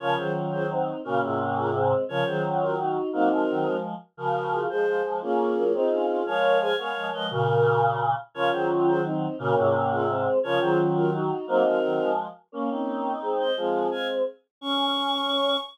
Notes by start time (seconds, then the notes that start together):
0.00 C#3 F3 C#4 F4 A#4 C#5
0.17 D#3 F#3 G#4 C5
0.52 G#4 C5
0.70 C4 D#4
1.04 A#2 C#3 A#3 C#4 F#4 A#4
1.22 G#2 C3 F4 G#4
1.57 F4 G#4
1.74 G#3 C4
2.09 C#3 F3 C#4 F4 A#4 C#5
2.26 D#3 F#3 G#4 C5
2.61 F#4 A#4
2.79 D#4 F#4
3.13 F#3 A#3 C4 D#4 F#4 A#4
3.30 F3 G#3 F#4 A#4
3.49 D#3 F#3
3.66 F3 G#3
4.17 C#3 F3 F#4 A#4
4.52 F4 G#4
4.69 F3 G#3 G#4 C5
4.86 F3 G#3
5.05 F3 G#3
5.21 A#3 C#4 F4 G#4
5.56 F#3 A#3
5.74 C4 D#4 F4 G#4
5.91 C#4 F4
6.09 C#4 F4
6.26 F3 G#3 A#4 C#5 F5
6.61 G#4 C5 F5 G#5
6.78 G#3 B3 A#4 C#5 F5
6.95 F3 G#3
7.13 F3 G#3 B4 D#5
7.30 A#2 C#3 F#4 A#4
8.34 C#3 F3 C#4 F4 A#4 C#5
8.52 D#3 F#3 G#4 C5
8.87 G#4 C5
9.05 C4 D#4
9.38 A#2 C#3 A#3 C#4 F#4 A#4
9.56 G#2 C3 F4 G#4
9.91 F4 G#4
10.09 G#3 C4
10.43 C#3 F3 C#4 F4 A#4 C#5
10.60 D#3 F#3 G#4 C5
10.96 F#4 A#4
11.13 D#4 F#4
11.47 F#3 A#3 C4 D#4 F#4 A#4
11.64 F3 G#3 F#4 A#4
11.83 D#3 F#3
11.99 F3 G#3
12.52 A#3 C#4
12.69 C4 D#4
13.22 G#3 C4
13.39 C5 D#5
13.57 F3 G#3 C4 F4 G#4
13.91 F5 G#5
14.61 C#4 C#6